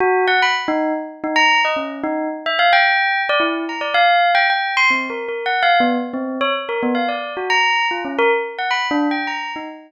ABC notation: X:1
M:3/4
L:1/16
Q:1/4=110
K:none
V:1 name="Tubular Bells"
^F2 ^f b z ^D2 z2 D ^a2 | ^d ^C2 ^D2 z e f g4 | d E2 ^a d f3 g g2 c' | (3C2 ^A2 A2 (3^f2 =f2 B,2 z C2 ^c |
z ^A B, f d2 ^F ^a3 =F ^C | ^A z2 ^f (3b2 D2 g2 ^a2 ^D z |]